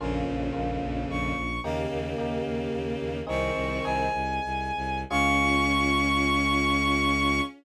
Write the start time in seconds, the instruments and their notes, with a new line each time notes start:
0.00 violin A#1 F2 C#3, electric piano 1 A#3 C#4 F4
0.27 violin A#1
0.53 violin A#1, electric piano 1 A#3 C#4 F4
0.82 violin A#1
1.09 violin A#1 C#6
1.36 violin A#1
1.63 violin D#2 C#3 A#3, electric piano 1 A#3 D#4 G4
1.91 violin D#2
2.18 violin D#2, electric piano 1 A#3 D#4 G4
2.45 violin D#2
2.73 violin D#2
3.00 violin D#2
3.27 violin C2 D#3 C4 C#6, electric piano 1 C4 D#4 G#4
3.55 violin C2
3.83 violin C2 G#5, electric piano 1 C4 D#4 G#4
4.14 violin C2
4.44 violin C2
4.76 violin C2
5.10 violin C#2 C#4 C#6, electric piano 1 C#4 F4 G#4